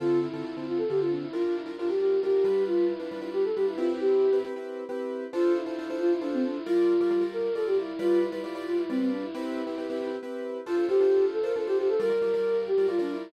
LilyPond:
<<
  \new Staff \with { instrumentName = "Flute" } { \time 6/8 \key d \minor \tempo 4. = 90 f'8 e'4 f'16 a'16 g'16 f'16 d'16 e'16 | f'16 f'16 e'16 r16 f'16 g'16 g'8 g'4 | f'8 e'4 g'16 a'16 g'16 e'16 f'16 e'16 | g'4 r2 |
f'8 e'4 f'16 e'16 d'16 c'16 d'16 e'16 | f'4. bes'8 a'16 g'16 e'8 | f'8 e'4 f'16 e'16 c'16 c'16 d'16 e'16 | e'2 r4 |
f'8 g'4 a'16 bes'16 a'16 g'16 g'16 a'16 | bes'4. g'8 f'16 d'16 e'8 | }
  \new Staff \with { instrumentName = "Acoustic Grand Piano" } { \time 6/8 \key d \minor <d c' f' a'>8. <d c' f' a'>16 <d c' f' a'>16 <d c' f' a'>8. <d c' f' a'>4 | <g d' f' bes'>8. <g d' f' bes'>16 <g d' f' bes'>16 <g d' f' bes'>8. <g d' f' bes'>8 <g d' f' b'>8~ | <g d' f' b'>8. <g d' f' b'>16 <g d' f' b'>16 <g d' f' b'>8. <g d' f' b'>8 <c' e' g' b'>8~ | <c' e' g' b'>8. <c' e' g' b'>16 <c' e' g' b'>16 <c' e' g' b'>8. <c' e' g' b'>4 |
<d' f' a' c''>8. <d' f' a' c''>16 <d' f' a' c''>16 <d' f' a' c''>8. <d' f' a' c''>4 | <g f' bes' d''>8. <g f' bes' d''>16 <g f' bes' d''>16 <g f' bes' d''>8. <g f' bes' d''>4 | <g f' b' d''>8. <g f' b' d''>16 <g f' b' d''>16 <g f' b' d''>8. <g f' b' d''>4 | <c' e' g' b'>8. <c' e' g' b'>16 <c' e' g' b'>16 <c' e' g' b'>8. <c' e' g' b'>4 |
<d' f' a' c''>16 <d' f' a' c''>16 <d' f' a' c''>16 <d' f' a' c''>4 <d' f' a' c''>16 <d' f' a' c''>16 <d' f' a' c''>8. | <g f' bes' d''>16 <g f' bes' d''>16 <g f' bes' d''>16 <g f' bes' d''>4 <g f' bes' d''>16 <g f' bes' d''>16 <g f' bes' d''>8. | }
>>